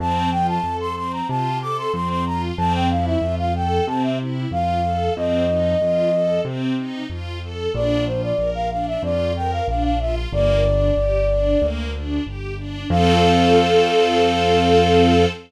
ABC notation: X:1
M:4/4
L:1/16
Q:1/4=93
K:F
V:1 name="Flute"
a2 g a2 c' c' b a2 d' c' c' c' b z | a g f e2 f g2 a e z2 f4 | _e8 z8 | d2 c d2 f f e d2 g f f f e z |
d10 z6 | f16 |]
V:2 name="String Ensemble 1"
C2 F2 A2 C2 F2 A2 C2 F2 | C2 E2 F2 A2 C2 E2 F2 A2 | C2 _E2 F2 A2 C2 E2 F2 A2 | D2 F2 B2 D2 F2 B2 D2 F2 |
B,2 D2 G2 D2 B,2 D2 G2 D2 | [CFA]16 |]
V:3 name="Acoustic Grand Piano" clef=bass
F,,4 F,,4 C,4 F,,4 | F,,4 F,,4 C,4 F,,4 | F,,4 F,,4 C,4 F,,4 | B,,,4 B,,,4 F,,4 B,,,4 |
G,,,4 G,,,4 D,,4 G,,,4 | F,,16 |]